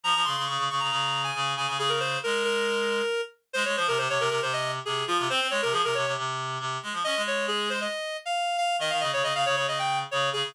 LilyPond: <<
  \new Staff \with { instrumentName = "Clarinet" } { \time 4/4 \key f \minor \tempo 4 = 137 bes''8 c'''8 des'''8 des'''16 bes''4 aes''8. aes''8 | aes'16 bes'16 c''8 bes'8 bes'2 r8 | c''16 des''16 c''16 bes'16 c''16 des''16 bes'16 bes'16 c''16 ees''8 r16 aes'8 f'8 | c''8 des''16 bes'16 aes'16 bes'16 des''8 r2 |
ees''8 des''8 aes'8 c''16 ees''4 f''8. f''8 | ees''16 f''16 ees''16 des''16 ees''16 f''16 des''16 des''16 ees''16 g''8 r16 des''8 aes'8 | }
  \new Staff \with { instrumentName = "Clarinet" } { \time 4/4 \key f \minor f16 f16 des16 des16 des16 des16 des16 des16 des4 des8 des16 des16 | des4 aes2 r4 | aes16 aes16 f16 c16 c16 c16 c16 c16 c4 c8 f16 c16 | c'16 c'16 aes16 c16 f16 c16 c16 c16 c4 c8 aes16 f16 |
des'16 aes4.~ aes16 r2 | ees16 ees16 des16 des16 des16 des16 des16 des16 des4 des8 des16 des16 | }
>>